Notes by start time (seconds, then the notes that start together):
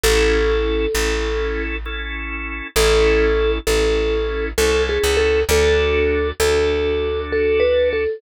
0.04 A1 C#4 E4 A4
0.95 A1 C#4 E4 A4
1.86 C#4 E4 A4
2.76 A1 C#4 E4 A4
3.67 A1 C#4 E4 A4
4.58 C2 C#4 E4 A4
4.89 G#4
5.04 C#2
5.17 A4
5.49 D2 D4 F#4 A4
6.40 D2 D4 F#4 A4
7.32 A4
7.60 B4
7.93 A4